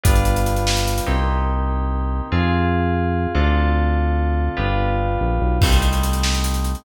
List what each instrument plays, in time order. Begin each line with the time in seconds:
0.04 synth bass 1 G1, electric piano 2 G3 B3 D4 F4, kick, closed hi-hat
0.15 closed hi-hat
0.25 closed hi-hat
0.36 closed hi-hat
0.46 closed hi-hat
0.56 closed hi-hat
0.67 snare
0.77 closed hi-hat
0.87 closed hi-hat
0.98 closed hi-hat
1.06 synth bass 1 C2, electric piano 2 A#3 C4 D#4 G4
2.32 synth bass 1 F2, electric piano 2 C4 F4 G#4
3.35 synth bass 1 D2, electric piano 2 C4 D4 F4 A4
4.57 synth bass 1 G1, electric piano 2 B3 D4 F4 G4
5.21 synth bass 1 A#1
5.41 synth bass 1 B1
5.61 synth bass 1 C2, electric piano 2 G3 A3 C4 D#4, kick, crash
5.72 closed hi-hat
5.82 closed hi-hat
5.93 closed hi-hat
6.03 closed hi-hat
6.13 closed hi-hat
6.23 snare
6.34 closed hi-hat
6.44 closed hi-hat
6.54 closed hi-hat
6.64 closed hi-hat
6.75 closed hi-hat